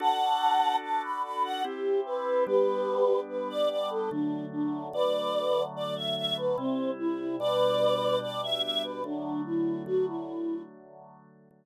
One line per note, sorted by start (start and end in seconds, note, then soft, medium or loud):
0.00 1.63 D4 medium
0.00 1.63 F#4 medium
0.00 1.63 A4 medium
0.00 0.76 F#5 loud
0.00 0.76 A5 loud
0.82 1.02 A5 loud
1.03 1.22 B5 medium
1.23 1.43 B5 loud
1.44 1.63 F#5 loud
1.64 2.46 C4 medium
1.64 2.46 E4 medium
1.64 2.46 G4 medium
1.64 2.00 G4 loud
2.05 2.44 B4 loud
2.47 4.09 G3 medium
2.47 4.09 B3 medium
2.47 4.09 D4 medium
2.47 3.20 G4 loud
2.47 3.20 B4 loud
3.29 3.48 B4 medium
3.49 3.69 D5 loud
3.70 3.89 D5 medium
3.90 4.10 A4 loud
4.11 4.92 D3 medium
4.11 4.92 F#3 medium
4.11 4.92 A3 medium
4.11 4.45 D4 loud
4.52 4.88 D4 medium
4.93 6.56 D3 medium
4.93 6.56 F#3 medium
4.93 6.56 A3 medium
4.93 5.63 B4 medium
4.93 5.63 D5 loud
5.75 5.95 D5 loud
5.96 6.15 E5 medium
6.16 6.36 E5 loud
6.37 6.57 B4 loud
6.58 7.39 C3 medium
6.58 7.39 G3 medium
6.58 6.91 C4 loud
6.58 7.39 E4 medium
6.99 7.36 E4 loud
7.40 9.03 B2 medium
7.40 9.03 G3 medium
7.40 9.03 D4 medium
7.40 8.18 B4 loud
7.40 8.18 D5 loud
8.22 8.41 D5 loud
8.42 8.62 E5 loud
8.63 8.83 E5 loud
8.84 9.03 B4 loud
9.04 9.85 D3 medium
9.04 9.85 F#3 medium
9.04 9.85 A3 medium
9.04 9.41 D4 medium
9.45 9.82 E4 medium
9.86 11.49 D3 medium
9.86 11.49 F#3 medium
9.86 11.49 A3 medium
9.86 10.06 F#4 loud
10.07 10.62 E4 loud
11.51 11.65 D3 medium
11.51 11.65 F#3 medium
11.51 11.65 A3 medium